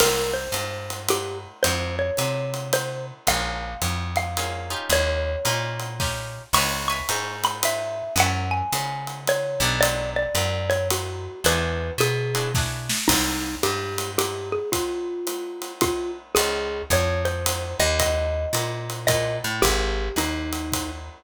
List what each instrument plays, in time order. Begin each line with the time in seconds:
0.00 electric bass (finger) C2, acoustic guitar (steel) A#3 C4 D#4 G4, xylophone A#4, crash, ride
0.34 xylophone C5
0.52 electric bass (finger) G2, hi-hat pedal, ride
0.90 ride
1.09 xylophone G4, ride
1.63 electric bass (finger) F2, xylophone C5, ride
1.99 xylophone C#5
2.17 electric bass (finger) C3, hi-hat pedal, ride
2.54 ride
2.73 xylophone C5, ride
3.27 electric bass (finger) A#1, acoustic guitar (steel) A#3 C#4 F4 G#4, xylophone F5, kick, ride
3.82 electric bass (finger) F2, hi-hat pedal, ride
4.16 xylophone F5, ride
4.37 acoustic guitar (steel) A#3 C#4 F4 G#4, ride
4.70 acoustic guitar (steel) C#4 D#4 F4 G4
4.90 electric bass (finger) D#2, xylophone C#5, ride
5.45 electric bass (finger) A#2, acoustic guitar (steel) C#4 D#4 F4 G4, hi-hat pedal, ride
5.80 ride
6.00 acoustic guitar (steel) C#4 D#4 F4 G4, kick, snare
6.53 electric bass (finger) C#2, acoustic guitar (steel) B4 C#5 E5 G#5, xylophone C#6, crash, ride
6.88 acoustic guitar (steel) B4 C#5 E5 G#5, xylophone C#6
7.09 electric bass (finger) G#2, hi-hat pedal, ride
7.44 xylophone B5, ride
7.63 xylophone E5, ride
8.16 electric bass (finger) F#2, acoustic guitar (steel) C#5 E5 F#5 A5, ride
8.20 xylophone F#5
8.51 xylophone G#5
8.72 electric bass (finger) C#3, hi-hat pedal, ride
9.07 ride
9.27 xylophone C#5, ride
9.60 electric bass (finger) B1, acoustic guitar (steel) B3 D4 F#4 A4
9.81 xylophone D5, ride
10.16 xylophone D5
10.35 electric bass (finger) F#2, hi-hat pedal, ride
10.70 xylophone C#5, ride
10.90 xylophone F#4, ride
11.44 electric bass (finger) E2, acoustic guitar (steel) D4 E4 F#4 G#4, xylophone B4, ride
11.98 electric bass (finger) B2, xylophone G#4, hi-hat pedal, ride
12.35 acoustic guitar (steel) D4 E4 F#4 G#4, ride
12.55 acoustic guitar (steel) D4 E4 F#4 G#4, kick, snare
12.89 snare
13.08 electric bass (finger) C2, xylophone D#4, kick, crash, ride
13.63 electric bass (finger) G2, xylophone G4, hi-hat pedal, ride
13.98 ride
14.18 xylophone G4, ride
14.52 xylophone G#4
14.72 xylophone F4, kick, ride
15.27 hi-hat pedal, ride
15.62 ride
15.81 xylophone F4, kick, ride
16.35 electric bass (finger) C#2, xylophone G#4, ride
16.90 electric bass (finger) F2, xylophone C#5, kick, hi-hat pedal, ride
17.25 xylophone C5, ride
17.46 ride
17.80 electric bass (finger) D#2, xylophone D#5
18.00 xylophone D#5, kick, ride
18.53 electric bass (finger) A#2, hi-hat pedal, ride
18.90 ride
19.07 electric bass (finger) A#2, xylophone D#5, kick, ride
19.44 electric bass (finger) A2
19.62 electric bass (finger) G#1, xylophone G4, kick, ride
20.16 electric bass (finger) D#2, xylophone D#4, hi-hat pedal, ride
20.53 ride
20.72 kick, ride